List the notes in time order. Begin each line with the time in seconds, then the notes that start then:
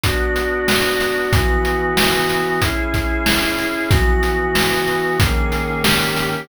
0.03 B3 D4 F#4, kick, closed hi-hat
0.36 closed hi-hat
0.68 snare
1.00 snare, closed hi-hat
1.33 E3 B3 F#4, kick, closed hi-hat
1.65 closed hi-hat
1.97 snare
2.29 closed hi-hat
2.61 C#4 E4 G#4, kick, closed hi-hat
2.94 kick, closed hi-hat
3.26 snare
3.58 snare, closed hi-hat
3.90 E3 B3 F#4, kick, closed hi-hat
4.23 closed hi-hat
4.55 snare
4.87 closed hi-hat
5.19 D#3 A#3 C#4 G#4, kick, closed hi-hat
5.52 snare, closed hi-hat
5.84 D#3 A#3 C#4 G4, snare
6.16 snare, closed hi-hat